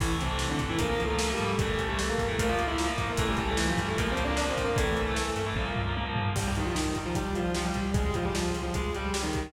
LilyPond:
<<
  \new Staff \with { instrumentName = "Distortion Guitar" } { \time 4/4 \key a \phrygian \tempo 4 = 151 <e e'>16 r16 <c c'>8. <d d'>16 r16 <e e'>16 \tuplet 3/2 { <bes bes'>4 <a a'>4 <g g'>4 } | <a a'>8. <g g'>16 <a a'>16 <bes bes'>8 <a a'>16 <bes bes'>16 <f' f''>8 <e' e''>8 r8 <bes bes'>16 | <a a'>16 <g g'>16 <g g'>16 <a a'>16 <e e'>16 <f f'>16 <g g'>16 <a a'>16 \tuplet 3/2 { <bes bes'>8 <c' c''>8 <d' d''>8 <d' d''>8 <c' c''>8 <bes bes'>8 } | <a a'>4. r2 r8 |
\key c \phrygian <g g'>16 <g g'>16 <ees ees'>16 <f f'>16 <ees ees'>8 r16 <f f'>16 <g g'>8 <f f'>8 <f f'>16 <g g'>8. | <aes aes'>16 <aes aes'>16 <f f'>16 <g g'>16 <f f'>8 r16 <f f'>16 <aes aes'>8 <g g'>8 <g g'>16 <ees ees'>8. | }
  \new Staff \with { instrumentName = "Overdriven Guitar" } { \time 4/4 \key a \phrygian <e a>8. <e a>4 <e a>16 <f bes>16 <f bes>8 <f bes>16 <f bes>16 <f bes>8. | <e a>8. <e a>4 <e a>16 <f bes>16 <f bes>8 <f bes>16 <f bes>16 <f bes>8. | <e a>8. <e a>4 <e a>16 <f bes>16 <f bes>8 <f bes>16 <f bes>16 <f bes>8. | <e a>8. <e a>4 <e a>16 <f bes>16 <f bes>8 <f bes>16 <f bes>16 <f bes>8. |
\key c \phrygian r1 | r1 | }
  \new Staff \with { instrumentName = "Electric Bass (finger)" } { \clef bass \time 4/4 \key a \phrygian a,,8 c,4 g,8 bes,,8 des,4 gis,8 | a,,8 c,4 g,8 bes,,8 des,4 gis,8 | a,,8 c,4 g,8 bes,,8 des,4 gis,8 | a,,8 c,4 g,8 bes,,8 des,4 gis,8 |
\key c \phrygian c,8 c,8 c,8 c,8 c,8 c,8 c,8 c,8 | des,8 des,8 des,8 des,8 des,8 des,8 des,8 des,8 | }
  \new DrumStaff \with { instrumentName = "Drums" } \drummode { \time 4/4 <cymc bd>8 hh8 sn8 <hh bd>8 <hh bd>8 hh8 sn8 hh8 | <hh bd>8 <hh bd>8 sn8 <hh bd>8 <hh bd>8 hh8 sn8 <hh bd>8 | <hh bd>8 <hh bd>8 sn8 <hh bd>8 <hh bd>8 hh8 sn8 <hh bd>8 | <hh bd>8 hh8 sn8 hh8 <bd tommh>8 tomfh8 tommh8 tomfh8 |
<cymc bd>8 hh8 sn8 <hh bd>8 <hh bd>8 hh8 sn8 <hh bd>8 | <hh bd>8 <hh bd>8 sn8 hh8 <hh bd>8 hh8 sn8 <hh bd>8 | }
>>